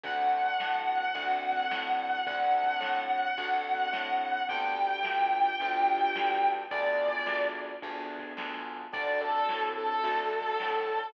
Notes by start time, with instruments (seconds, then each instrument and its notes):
0.03 electric bass (finger) D2, acoustic grand piano A3 C4 D4 F#4, distortion guitar F#5, kick, closed hi-hat
0.41 closed hi-hat
0.60 electric bass (finger) A2, snare
0.97 closed hi-hat
1.14 electric bass (finger) D2, acoustic grand piano A3 C4 D4 F#4, kick, closed hi-hat
1.53 kick, closed hi-hat
1.71 electric bass (finger) A2, snare
2.08 closed hi-hat
2.27 electric bass (finger) D2, acoustic grand piano A3 C4 D4 F#4, distortion guitar F#5, kick, closed hi-hat
2.64 kick, closed hi-hat
2.80 electric bass (finger) A2, snare
3.19 closed hi-hat
3.38 electric bass (finger) D2, acoustic grand piano A3 C4 D4 F#4, kick, closed hi-hat
3.75 kick, closed hi-hat
3.93 electric bass (finger) A2, snare
4.30 closed hi-hat
4.49 electric bass (finger) D2, acoustic grand piano B3 D4 F4 G4, distortion guitar G5, kick, closed hi-hat
4.86 closed hi-hat
5.03 electric bass (finger) D2, snare
5.41 closed hi-hat
5.60 electric bass (finger) D2, acoustic grand piano B3 D4 F4 G4, kick, closed hi-hat
5.97 kick, closed hi-hat
6.16 electric bass (finger) D2, snare
6.53 closed hi-hat
6.71 electric bass (finger) D2, acoustic grand piano B3 D4 F4 G#4, distortion guitar D5, kick, closed hi-hat
7.08 kick, closed hi-hat
7.26 electric bass (finger) D2, snare
7.64 closed hi-hat
7.82 electric bass (finger) D2, acoustic grand piano B3 D4 F4 G#4, kick, closed hi-hat
8.19 kick, closed hi-hat
8.37 electric bass (finger) D2, snare
8.75 closed hi-hat
8.92 electric bass (finger) D2, acoustic grand piano C4 D4 F#4 A4, distortion guitar D5, kick, closed hi-hat
9.21 distortion guitar A4
9.30 closed hi-hat
9.49 electric bass (finger) A2, snare
9.77 distortion guitar A4
9.86 closed hi-hat
10.03 electric bass (finger) D2, acoustic grand piano C4 D4 F#4 A4, kick, closed hi-hat
10.41 kick, closed hi-hat
10.60 electric bass (finger) A2, snare
10.97 closed hi-hat